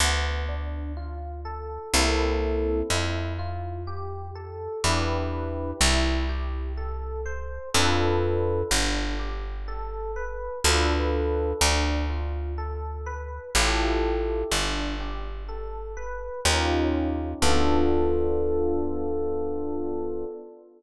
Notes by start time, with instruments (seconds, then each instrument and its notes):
0.00 electric bass (finger) D2, electric piano 1 B3
0.48 electric piano 1 D4
0.97 electric piano 1 F4
1.45 electric piano 1 A4
1.93 electric bass (finger) C2, electric piano 1 A#3 C4 E4 A4
2.90 electric bass (finger) F2, electric piano 1 E4
3.39 electric piano 1 F4
3.87 electric piano 1 G4
4.35 electric piano 1 A4
4.84 electric bass (finger) E2, electric piano 1 D4 E4 G4 B4
5.81 electric bass (finger) C2, electric piano 1 E4
6.29 electric piano 1 G4
6.77 electric piano 1 A4
7.26 electric piano 1 C5
7.74 electric bass (finger) F2, electric piano 1 D4 F4 A4 B4
8.71 electric bass (finger) G1, electric piano 1 D4
9.19 electric piano 1 G4
9.68 electric piano 1 A4
10.16 electric piano 1 B4
10.64 electric bass (finger) D2, electric piano 1 D4 F4 A4 B4
11.61 electric bass (finger) D2, electric piano 1 D4
12.10 electric piano 1 F4
12.58 electric piano 1 A4
13.06 electric piano 1 B4
13.55 electric bass (finger) A1, electric piano 1 E4 F4 G4 A4
14.51 electric bass (finger) G1, electric piano 1 D4
15.00 electric piano 1 G4
15.49 electric piano 1 A4
15.97 electric piano 1 B4
16.45 electric bass (finger) D#2, electric piano 1 C#4 D#4 F4 G4
17.42 electric bass (finger) D2, electric piano 1 B3 D4 F4 A4